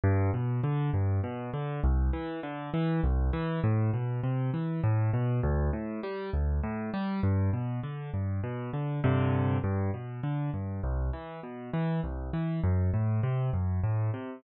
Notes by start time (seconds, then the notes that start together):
0.04 G2
0.34 B2
0.64 D3
0.94 G2
1.24 B2
1.54 D3
1.84 C2
2.13 E3
2.43 D3
2.74 E3
3.04 C2
3.33 E3
3.64 A2
3.94 B2
4.24 C3
4.54 E3
4.84 A2
5.13 B2
5.43 D2
5.73 A2
6.03 G3
6.33 D2
6.63 A2
6.94 G3
7.23 G2
7.53 B2
7.83 D3
8.14 G2
8.44 B2
8.73 D3
9.04 G2 C3 D3
9.64 G2
9.94 B2
10.23 D3
10.54 G2
10.84 C2
11.13 E3
11.43 B2
11.73 E3
12.04 C2
12.33 E3
12.63 F#2
12.94 A2
13.23 C3
13.53 F#2
13.84 A2
14.14 C3